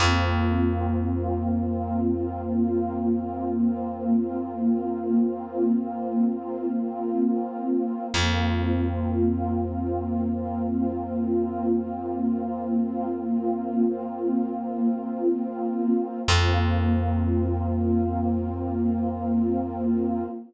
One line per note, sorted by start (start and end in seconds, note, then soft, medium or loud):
0.00 7.47 F2 medium
0.00 8.05 A#3 medium
0.00 8.05 C4 medium
0.00 8.05 F4 medium
8.13 15.62 F2 medium
8.13 16.19 A#3 medium
8.13 16.19 C4 medium
8.13 16.19 F4 medium
16.27 20.24 F2 loud
16.27 20.22 A#3 loud
16.27 20.22 C4 loud
16.27 20.22 F4 loud